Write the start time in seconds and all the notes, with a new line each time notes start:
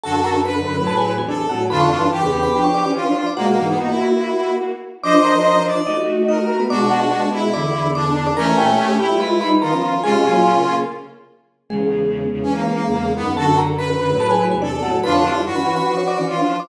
0.03 F#2 D3 F#4 A4 A5
0.24 A#4 A#5
0.45 B4 B5
0.66 F#2 D3
0.78 A2 F#3
0.87 A4 A5
0.97 G#4 G#5
1.17 E2 C3 G#4 G#5
1.28 D4 A4 D5
1.49 A2 F#3 F#4 F#5
1.70 F2 D3 D4 F4 B4 B5
1.81 C#5 C#6
1.91 G2 E3
2.11 G2 E3 G4
2.21 E2 C#3 B4 B5
2.43 B4 B5
2.52 F3 D4
2.64 C#5 C#6
2.74 D5 D6
2.84 E3 C#4 D5 D6
2.95 E3 C#4 F4
3.06 F3 D4
3.15 F3 D4
3.26 D5 D6
3.36 B2 G#3 A#3 F#4 F#5
3.47 A#3
3.58 G#2 E3
3.68 B3
3.78 A#3 D#4 F#4
3.88 E4
5.03 F3 D4 C5 D5 D#5 D6
5.24 A#4 A#5
5.35 A#4 A#5
5.67 D5
5.87 A3 D#4 F#4 D#5
6.28 D#4 A#4 D#5
6.60 B3 B4
6.70 B2 G#3 D4 F#4 D5 D6
6.91 F#4 F#5
7.01 F#4 F#5
7.33 E4
7.53 E2 D3 D5 D6
7.95 D4 D5 D6
8.26 D5 D6
8.36 E3 A3 C#4 A#4 A#5
8.58 A#2 A3 G4 G5
8.78 A3 G4
8.98 A3 E4 G4 G5
9.11 G3 F4
9.20 G#3 F4 B4 B5
9.41 G3 D#4 B4 B5
9.61 D#3 B3 F4 A#4 A#5
9.72 F3 C#4 A#4 A#5
10.03 C3 G#3 C#4 F4 G#4 G#5
10.14 C3 G#3
10.26 A#2 F#3
10.55 C#3 A#3
11.69 E2 C#3 G#3 G#4
12.32 E2 C#3
12.42 E3 C#4
12.54 A#3
12.74 A#3
12.86 E2 C#3
13.16 F#2 D#3 B3
13.36 F#2 D3 F#4 A4 A5
13.58 A#4 A#5
13.78 B4 B5
14.00 F#2 D3
14.11 A2 F#3
14.20 A4 A5
14.31 G#4 G#5
14.51 E2 C3 G#4 G#5
14.62 D4 A4 D5
14.82 A2 F#3 F#4 F#5
15.03 F2 D3 D4 F4 B4 B5
15.14 C#5 C#6
15.24 G3 E4
15.45 G2 E3 F#4
15.55 E3 C#4 B4 B5
15.76 B4 B5
15.86 F3 D4
15.97 C#5 C#6
16.08 D5 D6
16.17 E3 C#4 D5 D6
16.28 E3 C#4 F4
16.39 F3 D4
16.50 F3 D4
16.60 D5 D6